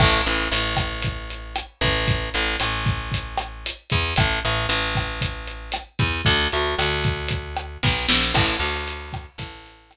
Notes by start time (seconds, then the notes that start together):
0.00 A1, kick, cross-stick, crash
0.26 A1, closed hi-hat
0.52 A1, closed hi-hat
0.77 kick, cross-stick, closed hi-hat
1.02 kick, closed hi-hat
1.30 closed hi-hat
1.56 cross-stick, closed hi-hat
1.81 A1, kick, closed hi-hat
2.08 kick, closed hi-hat
2.34 A1, closed hi-hat
2.60 A1, cross-stick, closed hi-hat
2.86 kick, closed hi-hat
3.12 kick, closed hi-hat
3.37 cross-stick, closed hi-hat
3.66 closed hi-hat
3.90 E2, kick, closed hi-hat
4.16 A1, kick, cross-stick, closed hi-hat
4.45 A1, closed hi-hat
4.69 A1, closed hi-hat
4.95 kick, cross-stick, closed hi-hat
5.21 kick, closed hi-hat
5.47 closed hi-hat
5.72 cross-stick, closed hi-hat
5.99 E2, kick, closed hi-hat
6.25 D2, kick, closed hi-hat
6.52 D2, closed hi-hat
6.78 D2, cross-stick, closed hi-hat
7.04 kick, closed hi-hat
7.28 kick, closed hi-hat
7.57 cross-stick, closed hi-hat
7.83 B1, kick, snare
8.09 A#1, snare
8.34 A1, kick, cross-stick, crash
8.60 D2, closed hi-hat
8.88 closed hi-hat
9.13 kick, cross-stick, closed hi-hat
9.38 A1, kick, closed hi-hat
9.66 closed hi-hat
9.91 cross-stick, closed hi-hat